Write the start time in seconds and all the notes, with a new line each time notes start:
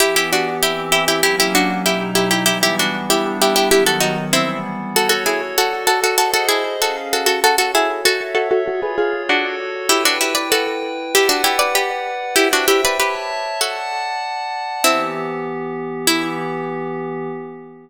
0.00 E3 B3 E4 G4
0.16 E4 G4
0.33 D4 F#4
0.61 E3 C4 E4 G4
0.92 E4 G4
1.08 E4 G4
1.23 F#3 A#3 C#4 E4 G4
1.40 E4 G4
1.55 D4 F#4
1.86 B2 F#3 D#4 E4 G4
2.15 E4 G4
2.31 E4 G4
2.46 E3 G3 B3 E4 G4
2.63 E4 G4
2.79 D4 F#4
3.09 G3 B3 D4 E4 G4
3.42 E4 G4
3.56 E4 G4
3.71 D#3 F#3 B3 E4 G4
3.86 F#4 A4
4.00 D#4 F#4
4.33 E3 G3 B3 C4 E4
4.94 F#4 A4 C#5
5.09 F#4 A4
5.26 E4 G#4
5.57 F#4 A4 D5
5.87 F#4 A4
6.04 F#4 A4
6.18 F#4 G#4 A4 C5 D#5
6.34 F#4 A4
6.49 E4 G#4
6.80 C#4 F#4 G#4 A4 F5
7.13 F#4 A4
7.26 F#4 A4
7.43 F#4 A4 C#5
7.58 F#4 A4
7.75 E4 G#4
8.04 F#4 A4 C#5 E5
8.35 F#4 A4
8.51 F#4 A4
8.66 F4 F#4 G#4 A4 C#5
8.82 G#4 B4
8.98 F4 G#4
9.29 D4 F#4 A4 C#5
9.89 E4 G4 B4 G5
10.05 D4 F#4
10.21 E4 G4
10.35 B4 D5
10.52 F#4 A4
11.14 E4 G4 B4 D5 F#5
11.29 D4 F#4
11.44 E4 G4
11.59 B4 D5
11.75 G4 B4
12.36 E4 G4 C5 E5 G5
12.53 D4 F#4
12.68 E4 G4
12.85 B4 D5
13.00 G4 B4 C#5 E5 A5
13.61 F#4 A4 D5 F#5 A5
14.84 E3 B3 C4 E4 G4
16.07 E3 B3 E4 G4